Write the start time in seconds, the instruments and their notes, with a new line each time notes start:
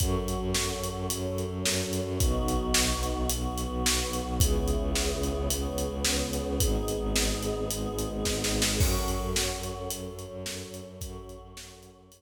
0.00 violin F#2, choir aahs C#4 F#4 A4, kick, closed hi-hat
0.18 violin F#2
0.28 closed hi-hat
0.37 violin F#2
0.54 violin F#2, snare
0.74 violin F#2
0.84 closed hi-hat
0.91 violin F#2
1.10 violin F#2, choir aahs C#4 A4 C#5, closed hi-hat
1.28 violin F#2
1.38 closed hi-hat
1.47 violin F#2
1.65 violin F#2, snare
1.84 violin F#2
1.93 closed hi-hat
2.02 violin F#2
2.20 violin B1, choir aahs B3 D#4 F#4, kick, closed hi-hat
2.39 violin B1
2.48 closed hi-hat
2.57 violin B1
2.74 violin B1, snare
2.93 violin B1
3.03 closed hi-hat
3.12 violin B1
3.30 violin B1, choir aahs B3 F#4 B4, closed hi-hat
3.49 violin B1
3.58 closed hi-hat
3.67 violin B1
3.85 violin B1, snare
4.04 violin B1
4.13 closed hi-hat
4.22 violin B1
4.40 violin C#2, choir aahs B3 C#4 E4 G#4, kick, closed hi-hat
4.59 violin C#2
4.68 closed hi-hat
4.77 violin C#2
4.95 violin C#2, snare
5.13 violin C#2
5.23 closed hi-hat
5.32 violin C#2
5.50 violin C#2, choir aahs B3 C#4 G#4 B4, closed hi-hat
5.69 violin C#2
5.78 closed hi-hat
5.87 violin C#2
6.05 violin C#2, snare
6.24 violin C#2
6.33 closed hi-hat
6.42 violin C#2
6.60 violin G#1, choir aahs B3 D#4 G#4, kick, closed hi-hat
6.78 violin G#1
6.88 closed hi-hat
6.97 violin G#1
7.15 violin G#1, snare
7.34 violin G#1
7.43 closed hi-hat
7.52 violin G#1
7.70 violin G#1, choir aahs G#3 B3 G#4, closed hi-hat
7.89 violin G#1
7.99 closed hi-hat
8.07 violin G#1
8.25 violin G#1, kick, snare
8.44 violin G#1, snare
8.62 violin G#1, snare
8.80 violin F#2, choir aahs C#4 F#4 A4, kick, crash
8.99 violin F#2
9.08 closed hi-hat
9.18 violin F#2
9.36 violin F#2, snare
9.55 violin F#2
9.63 closed hi-hat
9.73 violin F#2
9.90 violin F#2, choir aahs C#4 A4 C#5, closed hi-hat
10.09 violin F#2
10.19 closed hi-hat
10.28 violin F#2
10.46 violin F#2, snare
10.65 violin F#2
10.74 closed hi-hat
10.82 violin F#2
11.01 violin F#2, choir aahs C#4 F#4 A4, kick, closed hi-hat
11.19 violin F#2
11.29 closed hi-hat
11.37 violin F#2
11.56 violin F#2, snare
11.74 violin F#2
11.83 closed hi-hat
11.92 violin F#2
12.11 violin F#2, choir aahs C#4 A4 C#5, closed hi-hat